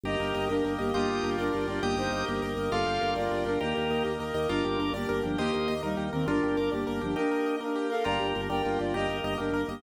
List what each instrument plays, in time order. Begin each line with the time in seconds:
0.04 drawbar organ G1 A#3 D#4 G4 A#4, acoustic grand piano G4, flute G4 D#5
0.20 drawbar organ G1, acoustic grand piano A#4
0.35 drawbar organ G1, acoustic grand piano D#5
0.49 drawbar organ G1 A#3 G4 A#4, flute D4 A#4, acoustic grand piano G4
0.65 drawbar organ G1, acoustic grand piano A#4
0.79 drawbar organ G1, flute A#3 G4, acoustic grand piano D#5
0.93 drawbar organ G1 A#3 D4 F4 G4 D#5 G5, flute A#3 G4, acoustic grand piano F4
1.08 drawbar organ G1, acoustic grand piano G4
1.23 drawbar organ G1, acoustic grand piano A#4
1.38 drawbar organ G1 A#3 D4 G4 A#4, flute D4 A#4, acoustic grand piano D5
1.53 drawbar organ G1, acoustic grand piano F4
1.67 drawbar organ G1, flute F4 D5, acoustic grand piano G4
1.82 drawbar organ G1 A#3 D#4 G4 D#5 G5, flute A#3 G4, acoustic grand piano G4
1.96 drawbar organ G1, flute D#4 C5, acoustic grand piano A#4
2.11 drawbar organ G1, acoustic grand piano D#5
2.27 drawbar organ G1 A#3 G4 A#4, flute A#3 G4, acoustic grand piano G4
2.42 drawbar organ G1, acoustic grand piano A#4
2.57 drawbar organ G1, acoustic grand piano D#5
2.72 drawbar organ G1 A#3 D4 F4 G4 D5 F5, acoustic grand piano F4, flute A4 F5
2.86 drawbar organ G1, acoustic grand piano G4
3.01 drawbar organ G1, acoustic grand piano A#4
3.16 drawbar organ G1 A#3 D4 G4 A#4, flute F4 D5, acoustic grand piano D5
3.31 drawbar organ G1, acoustic grand piano F4
3.45 drawbar organ G1, flute D4 A#4, acoustic grand piano G4
3.60 drawbar organ D#2 A#3 D#4 G4 A#4, flute A#3 G4, acoustic grand piano G4
3.75 drawbar organ D#2, acoustic grand piano A#4
3.90 drawbar organ D#2, acoustic grand piano D#5
4.04 drawbar organ D#2 A#3 G4 A#4, acoustic grand piano G4
4.19 drawbar organ D#2, acoustic grand piano A#4
4.34 drawbar organ D#2, acoustic grand piano D#5
4.49 drawbar organ G1 A#3 D4 F4 G4 A#4 D5, flute D4 A#4, acoustic grand piano F4
4.65 drawbar organ G1, acoustic grand piano G4
4.79 drawbar organ G1, acoustic grand piano A#4
4.93 drawbar organ G1 A#3 D4 G4 A#4, flute A#3 G4, acoustic grand piano D5
5.09 drawbar organ G1, acoustic grand piano A#4
5.23 drawbar organ G1, flute F3 D4, acoustic grand piano G4
5.37 drawbar organ D#2 A#3 D#4 G4 C5 D#5, flute A#3 G4, acoustic grand piano G4
5.53 drawbar organ D#2, acoustic grand piano A#4
5.68 drawbar organ D#2, acoustic grand piano D#5
5.82 drawbar organ D#2 A#3 G4 A#4, flute G3 D#4, acoustic grand piano A#4
5.97 drawbar organ D#2, acoustic grand piano G4
6.13 drawbar organ D#2, flute D#3 C4, acoustic grand piano A#4
6.26 drawbar organ G1 A#3 D4 F4 G4, flute D4 A#4, acoustic grand piano F4
6.43 drawbar organ G1, acoustic grand piano G4
6.57 drawbar organ G1 A#4 D5, acoustic grand piano A#4
6.72 drawbar organ G1 A#3 D4 G4 A#4, flute A#3 G4, acoustic grand piano D5
6.87 drawbar organ G1, acoustic grand piano A#4
7.01 drawbar organ G1, flute F3 D4, acoustic grand piano G4
7.15 drawbar organ A#3 D#4 G4, flute D4 A#4, acoustic grand piano G4
7.31 acoustic grand piano A#4
7.46 acoustic grand piano D#5
7.60 drawbar organ A#3 G4 A#4, flute D4 A#4, acoustic grand piano A#4
7.76 acoustic grand piano G4
7.90 flute A4 F5, acoustic grand piano A#4
8.04 drawbar organ G1 A#3 D4 F4 G4 A#4, acoustic grand piano F4, flute D5 A#5
8.20 drawbar organ G1, acoustic grand piano G4
8.35 drawbar organ G1, acoustic grand piano A#4
8.49 drawbar organ G1 A#3 D4 G4 A#4, flute A#4 G5, acoustic grand piano D5
8.65 drawbar organ G1, acoustic grand piano F4
8.79 drawbar organ G1, flute F4 D5, acoustic grand piano G4
8.94 drawbar organ G1 A#3 D#4 G4 A#4, acoustic grand piano G4, flute G4 D#5
9.08 drawbar organ G1, acoustic grand piano A#4
9.24 drawbar organ G1, acoustic grand piano D#5
9.38 drawbar organ G1 A#3 G4 A#4, flute D4 A#4, acoustic grand piano G4
9.52 drawbar organ G1, acoustic grand piano A#4
9.68 drawbar organ G1, flute A#3 G4, acoustic grand piano D#5